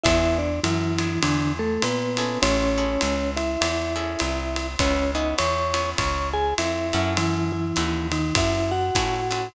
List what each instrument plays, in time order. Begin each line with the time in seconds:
0.03 electric bass (finger) E2, acoustic guitar (steel) B3 D4 E4 G#4, vibraphone E4 E5, kick, ride
0.38 vibraphone D4 D5
0.63 electric bass (finger) F#2, vibraphone E3 E4, hi-hat pedal, ride
0.98 acoustic guitar (steel) B3 D4 E4 G#4, ride
1.22 electric bass (finger) E2, vibraphone D3 D4, ride
1.59 vibraphone A3 A4
1.82 electric bass (finger) A#2, vibraphone B3 B4, hi-hat pedal, ride
2.17 acoustic guitar (steel) C#4 E4 G#4 A4, ride
2.42 electric bass (finger) A1, vibraphone C#4 C#5, ride
2.78 acoustic guitar (steel) C#4 E4 G#4 A4
3.01 electric bass (finger) C#2, hi-hat pedal, ride
3.37 vibraphone E4 E5, ride
3.61 electric bass (finger) E2, ride
3.96 acoustic guitar (steel) C#4 E4 G#4 A4
4.19 electric bass (finger) C2, hi-hat pedal, ride
4.56 ride
4.79 electric bass (finger) C#2, acoustic guitar (steel) B3 C#4 E4 G#4, vibraphone C#4 C#5, kick, ride
5.15 acoustic guitar (steel) B3 C#4 E4 G#4, vibraphone D#4 D#5
5.38 electric bass (finger) E2, vibraphone C#5 C#6, hi-hat pedal, ride
5.74 acoustic guitar (steel) B3 C#4 E4 G#4, ride
5.98 electric bass (finger) C#2, vibraphone C#5 C#6, kick, ride
6.33 vibraphone G#4 G#5
6.58 electric bass (finger) F2, vibraphone E4 E5, hi-hat pedal, ride
6.93 electric bass (finger) F#2, acoustic guitar (steel) C#4 E4 F#4 A4, ride
7.17 vibraphone E3 E4, ride
7.52 vibraphone E3 E4
7.76 electric bass (finger) D#2, acoustic guitar (steel) C#4 E4 F#4 A4, hi-hat pedal, ride
8.12 vibraphone D#3 D#4, ride
8.35 electric bass (finger) F#2, vibraphone E4 E5, kick, ride
8.71 vibraphone F#4 F#5
8.95 electric bass (finger) A2, acoustic guitar (steel) C#4 E4 F#4 A4, kick, hi-hat pedal, ride
9.31 acoustic guitar (steel) C#4 E4 F#4 A4, ride